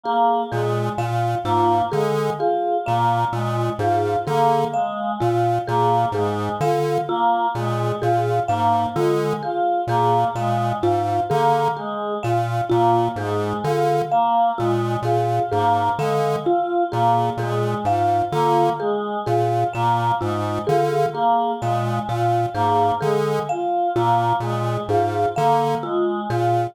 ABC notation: X:1
M:6/8
L:1/8
Q:3/8=43
K:none
V:1 name="Lead 1 (square)" clef=bass
z _B,, B,, | _A,, D, z _B,, B,, A,, | D, z _B,, B,, _A,, D, | z _B,, B,, _A,, D, z |
_B,, B,, _A,, D, z B,, | _B,, _A,, D, z B,, B,, | _A,, D, z _B,, B,, A,, | D, z _B,, B,, _A,, D, |
z _B,, B,, _A,, D, z | _B,, B,, _A,, D, z B,, |]
V:2 name="Choir Aahs"
_B, _A, F | _B, _A, F B, A, F | _B, _A, F B, A, F | _B, _A, F B, A, F |
_B, _A, F B, A, F | _B, _A, F B, A, F | _B, _A, F B, A, F | _B, _A, F B, A, F |
_B, _A, F B, A, F | _B, _A, F B, A, F |]
V:3 name="Marimba"
_A A f | F _A A f F A | _A f F A A f | F _A A f F A |
_A f F A A f | F _A A f F A | _A f F A A f | F _A A f F A |
_A f F A A f | F _A A f F A |]